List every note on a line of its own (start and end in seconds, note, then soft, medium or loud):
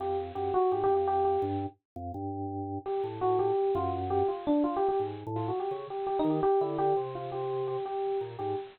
0.00 0.32 F2 medium
0.00 0.17 G4 medium
0.35 0.52 F#2 medium
0.35 0.51 G4 medium
0.54 0.70 F#4 loud
0.72 0.88 G#2 medium
0.72 0.83 G4 medium
0.84 0.94 G4 loud
0.90 1.38 F2 medium
0.95 1.06 G4 medium
1.07 1.24 G4 loud
1.25 1.41 G4 medium
1.42 1.66 G2 loud
1.96 2.12 F2 loud
2.14 2.79 G2 medium
2.86 3.02 G4 medium
3.04 3.52 A2 medium
3.21 3.37 F#4 medium
3.39 3.71 G4 medium
3.75 4.23 F#2 loud
3.75 3.91 F4 medium
4.10 4.26 G4 medium
4.28 4.44 F4 medium
4.47 4.63 D4 loud
4.64 4.75 F4 medium
4.76 4.87 G4 loud
4.89 4.99 G4 medium
5.00 5.24 G#2 medium
5.27 5.51 A2 loud
5.36 5.47 F4 medium
5.48 5.59 F#4 medium
5.60 5.70 G4 medium
5.71 5.87 C#3 medium
5.90 6.06 G4 medium
6.07 6.17 G4 medium
6.19 6.30 D#4 loud
6.24 6.40 D#3 medium
6.30 6.41 G4 medium
6.43 6.59 G4 loud
6.61 6.93 D3 medium
6.61 6.77 E4 medium
6.78 6.94 G4 loud
6.97 7.77 C3 medium
7.15 7.31 F4 medium
7.32 7.64 G4 medium
7.68 7.84 G4 medium
7.86 8.18 G4 medium
8.21 8.37 A#2 medium
8.39 8.55 G#2 medium
8.39 8.55 G4 medium